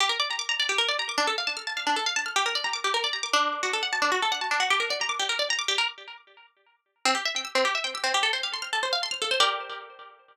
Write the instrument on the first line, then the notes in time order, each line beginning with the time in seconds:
pizzicato strings
0.00 G4
0.09 A#4
0.20 D5
0.31 A#5
0.39 D6
0.49 A#5
0.60 D5
0.69 G4
0.78 A#4
0.88 D5
0.99 A#5
1.09 D6
1.18 D4
1.27 A4
1.38 F5
1.47 A5
1.57 F6
1.67 A5
1.77 F5
1.87 D4
1.96 A4
2.06 F5
2.16 A5
2.26 F6
2.36 G4
2.46 A#4
2.55 D5
2.64 A#5
2.73 D6
2.84 G4
2.94 A#4
3.04 D5
3.13 A#5
3.23 D6
3.33 D4
3.63 F#4
3.73 A4
3.83 F#5
3.93 A5
4.02 D4
4.12 F#4
4.22 A4
4.32 F#5
4.41 A5
4.51 D4
4.60 F#4
4.70 G4
4.80 A#4
4.90 D5
5.01 A#5
5.09 D6
5.19 G4
5.29 A#4
5.39 D5
5.50 A#5
5.59 D6
5.68 G4
5.78 A#4
7.05 C4
7.15 G4
7.25 E5
7.36 G5
7.45 E6
7.55 C4
7.65 G4
7.75 E5
7.84 G5
7.95 E6
8.04 C4
8.14 G4
8.23 A4
8.33 C5
8.43 F5
8.54 C6
8.62 F6
8.73 A4
8.83 C5
8.93 F5
9.03 C6
9.11 F6
9.22 A4
9.31 C5
9.40 G4 A#4 D5